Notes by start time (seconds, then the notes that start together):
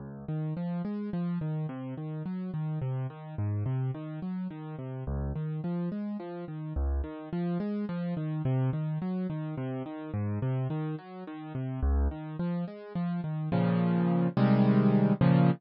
0.00 C#2
0.28 D#3
0.57 F3
0.85 G#3
1.13 F3
1.41 D#3
1.69 C3
1.98 D#3
2.26 F#3
2.54 D#3
2.82 C3
3.10 D#3
3.38 G#2
3.66 C3
3.94 D#3
4.22 F#3
4.50 D#3
4.79 C3
5.07 C#2
5.36 D#3
5.64 F3
5.92 G#3
6.20 F3
6.48 D#3
6.76 C#2
7.04 D#3
7.33 F3
7.60 G#3
7.89 F3
8.17 D#3
8.45 C3
8.73 D#3
9.02 F#3
9.30 D#3
9.58 C3
9.86 D#3
10.14 G#2
10.42 C3
10.70 D#3
10.98 F#3
11.27 D#3
11.55 C3
11.83 C#2
12.11 D#3
12.39 F3
12.68 G#3
12.95 F3
13.24 D#3
13.52 A#2 C#3 F3
14.37 C3 D#3 G3 G#3
15.21 A#2 C#3 F3